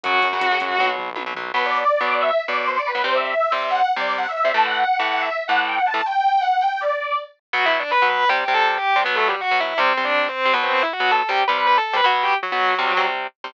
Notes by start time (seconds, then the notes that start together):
0.04 F#2 C#3 F#3 F#4 F#5, kick, closed hi-hat
0.14 kick
0.22 F#2, kick, closed hi-hat
0.33 C#3 F#3, kick
0.41 F#2, kick, closed hi-hat
0.51 C#3 F#3, kick
0.60 F#2, kick, closed hi-hat
0.70 kick
0.79 B1 B2 F#3, kick, high tom
0.98 B1, floor tom
1.16 B1 B2 F#3, high tom
1.26 B2 F#3
1.35 B1 B2 F#3, floor tom
1.54 B2 F#3 B3 B4
1.64 D5
1.74 D5
2.01 B2 F#3 B3
2.10 D5
2.20 E5
2.48 B2 F#3 B3 D5
2.67 C5
2.77 D5
2.86 B4
2.95 B2 F#3 B3
3.04 C3 G3 C4 C5
3.14 E5
3.23 E5
3.52 C3 G3 C4
3.61 E5
3.70 F#5
3.96 C3 G3 C4 D5
4.17 F#5
4.27 E5
4.36 E5
4.45 C3 G3 C4
4.54 A2 E3 A3 A5
4.64 F#5
4.73 F#5
4.99 A2 E3 A3
5.11 F#5
5.20 E5
5.48 A2 E3 A3 F#5
5.67 G5
5.77 F#5
5.86 A5
5.94 A2 E3 A3
6.05 G5
6.41 F#5
6.51 F#5
6.61 G5
6.70 G5
6.80 D5
7.53 B2 F#3 B3 F#4 F#5
7.66 E4 E5
7.79 D4 D5
7.91 B4 B5
8.02 B2 F#3 B3
8.09 B4 B5
8.29 C3 G3 C4 G4 G5
8.48 C3 G3 C4
8.54 A4 A5
8.78 G4 G5
8.96 C3 G3 C4
9.04 B2 F#3 B3 B4
9.15 A3 A4
9.28 G3 G4
9.41 F#4 F#5
9.51 B2 F#3 B3
9.60 E4 E5
9.78 C3 G3 C4 C5
9.97 C3 G3 C4
10.05 D4 D5
10.28 C4 C5
10.45 C3 G3 C4
10.53 B2 F#3 B3 B4
10.63 C4 C5
10.73 C4 C5
10.82 E4 E5
10.93 F#4 F#5
11.00 B2 F#3 B3
11.11 A4 A5
11.29 C3 G3 C4 G4 G5
11.48 C3 G3 C4 B4 B5
11.58 B4 B5
11.67 B4 B5
11.77 A4 A5
11.93 C3 G3 C4 B4 B5
12.04 B2 F#3 B3 F#4 F#5
12.22 G4 G5
12.43 F#3 F#4
12.52 B2 F#3 B3
12.79 C3 G3 C4
12.97 C3 G3 C4
13.44 C3 G3 C4